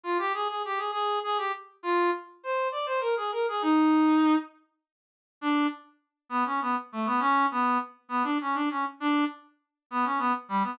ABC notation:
X:1
M:6/8
L:1/16
Q:3/8=67
K:Cm
V:1 name="Brass Section"
F G A A G A A2 A G z2 | F2 z2 c2 d c B A B A | E6 z6 | [K:Bm] D2 z4 B, C B, z A, B, |
C2 B,2 z2 B, D C D C z | D2 z4 B, C B, z G, B, |]